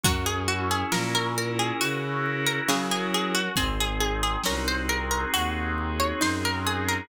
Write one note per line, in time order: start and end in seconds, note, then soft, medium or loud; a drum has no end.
0.03 0.84 F#2 medium
0.03 0.91 F#3 loud
0.03 1.35 C#4 loud
0.03 0.25 F#4 medium
0.03 kick loud
0.03 closed hi-hat medium
0.26 0.47 G#4 medium
0.48 3.42 E4 medium
0.48 0.69 F#4 medium
0.71 0.92 G#4 medium
0.92 1.72 A#2 medium
0.92 2.35 F3 medium
0.92 2.25 A#4 medium
0.92 1.13 A#4 medium
0.92 snare loud
1.15 1.36 A#4 medium
1.36 2.69 C#4 medium
1.36 1.59 A#4 medium
1.59 1.80 G#4 medium
1.81 2.60 C#3 medium
1.81 2.35 F#4 medium
1.81 3.13 F#4 medium
1.81 closed hi-hat medium
2.26 3.51 A#4 medium
2.47 2.67 A#4 medium
2.69 3.44 C#3 loud
2.69 3.48 F#3 medium
2.69 3.54 C#4 medium
2.69 2.90 G#4 medium
2.69 snare loud
2.91 3.12 G#4 medium
3.14 3.56 F#4 medium
3.14 3.35 G#4 medium
3.35 3.56 F#4 medium
3.56 4.37 G#1 medium
3.56 4.42 C4 loud
3.56 5.33 C4 loud
3.56 3.77 G#4 medium
3.56 kick medium
3.56 closed hi-hat medium
3.80 4.00 G#4 medium
4.00 5.77 D#4 medium
4.00 4.21 G#4 medium
4.23 4.44 G#4 medium
4.44 5.25 C2 medium
4.44 6.10 C#4 medium
4.44 6.22 F#4 medium
4.44 4.67 A#4 medium
4.44 snare loud
4.68 4.89 C5 medium
4.89 6.64 G#4 medium
4.89 5.10 A#4 medium
5.11 5.32 A#4 medium
5.33 6.13 D#2 medium
5.33 7.01 C4 medium
5.33 5.92 F#4 medium
5.33 closed hi-hat loud
5.78 7.04 D#4 medium
6.00 6.21 C#5 medium
6.21 7.01 F#2 medium
6.21 6.97 D#4 medium
6.21 7.06 F#4 medium
6.21 6.43 C5 medium
6.21 snare medium
6.45 6.66 A#4 medium
6.65 7.07 G#4 medium
6.65 6.88 G#4 medium
6.88 7.08 A#4 medium